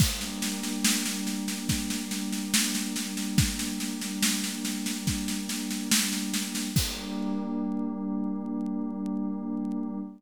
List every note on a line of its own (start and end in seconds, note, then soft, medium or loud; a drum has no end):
0.00 6.69 G3 medium
0.00 6.69 A#3 medium
0.00 6.69 D4 medium
0.00 kick loud
0.00 snare medium
0.00 crash loud
0.21 snare medium
0.42 snare medium
0.63 snare medium
0.85 snare loud
1.06 snare medium
1.27 snare medium
1.48 snare medium
1.69 kick medium
1.69 snare medium
1.90 snare medium
2.11 snare medium
2.32 snare medium
2.54 snare loud
2.75 snare medium
2.96 snare medium
3.17 snare medium
3.38 kick loud
3.38 snare loud
3.59 snare medium
3.80 snare medium
4.01 snare medium
4.23 snare loud
4.44 snare medium
4.65 snare medium
4.86 snare medium
5.07 kick medium
5.07 snare medium
5.28 snare medium
5.49 snare medium
5.71 snare medium
5.91 snare loud
6.12 snare medium
6.34 snare medium
6.55 snare medium
6.75 9.99 G3 loud
6.75 9.99 A#3 loud
6.75 9.99 D4 medium
6.75 kick loud
6.75 crash loud